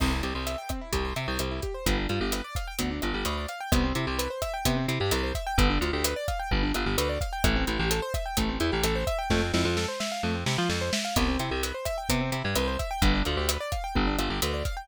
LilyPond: <<
  \new Staff \with { instrumentName = "Acoustic Grand Piano" } { \time 4/4 \key c \major \tempo 4 = 129 c'16 e'16 g'16 c''16 e''16 g''16 c'16 e'16 g'16 c''16 e''16 g''16 c'16 e'16 g'16 c''16 | b16 d'16 f'16 g'16 b'16 d''16 f''16 g''16 b16 d'16 f'16 g'16 b'16 d''16 f''16 g''16 | b16 c'16 e'16 g'16 b'16 c''16 e''16 g''16 b16 c'16 e'16 g'16 b'16 c''16 e''16 g''16 | b16 d'16 f'16 g'16 b'16 d''16 f''16 g''16 b16 d'16 f'16 g'16 b'16 d''16 f''16 g''16 |
a16 c'16 e'16 g'16 a'16 c''16 e''16 g''16 a16 c'16 e'16 g'16 a'16 c''16 e''16 g''16 | a16 c'16 e'16 f'16 a'16 c''16 e''16 f''16 a16 c'16 e'16 f'16 a'16 c''16 e''16 f''16 | b16 c'16 e'16 g'16 b'16 c''16 e''16 g''16 b16 c'16 e'16 g'16 b'16 c''16 e''16 g''16 | b16 d'16 f'16 g'16 b'16 d''16 f''16 g''16 b16 d'16 f'16 g'16 b'16 d''16 f''16 g''16 | }
  \new Staff \with { instrumentName = "Electric Bass (finger)" } { \clef bass \time 4/4 \key c \major c,8 c,16 c,4~ c,16 c,8 c16 c,16 c,4 | g,,8 g,16 g,,4~ g,,16 d,8 g,,16 g,,16 d,4 | c,8 c16 c,4~ c,16 c8 c16 g,16 c,4 | g,,8 d,16 d,4~ d,16 g,,8 g,,16 g,,16 d,4 |
a,,8 a,,16 a,,4~ a,,16 a,,8 e,16 a,,16 a,,4 | f,8 f,16 f,4~ f,16 f,8 c16 f16 f,4 | c,8 c16 c,4~ c,16 c8 c16 g,16 c,4 | g,,8 d,16 d,4~ d,16 g,,8 g,,16 g,,16 d,4 | }
  \new DrumStaff \with { instrumentName = "Drums" } \drummode { \time 4/4 <cymc bd ss>8 hh8 hh8 <hh bd ss>8 <hh bd>8 hh8 <hh ss>8 <hh bd>8 | <hh bd>8 hh8 <hh ss>8 <hh bd>8 <hh bd>8 <hh ss>8 hh8 hh8 | <hh bd ss>8 hh8 hh8 <hh bd ss>8 <hh bd>8 hh8 <hh ss>8 <hh bd>8 | <hh bd>8 hh8 <hh ss>8 <hh bd>8 bd8 <hh ss>8 hh8 <hh bd>8 |
<hh bd ss>8 hh8 hh8 <hh bd ss>8 <hh bd>8 hh8 <hh ss>8 <hh bd>8 | <bd sn>8 sn8 sn8 sn8 r8 sn8 sn8 sn8 | <hh bd ss>8 hh8 hh8 <hh bd ss>8 <hh bd>8 hh8 <hh ss>8 <hh bd>8 | <hh bd>8 hh8 <hh ss>8 <hh bd>8 bd8 <hh ss>8 hh8 <hh bd>8 | }
>>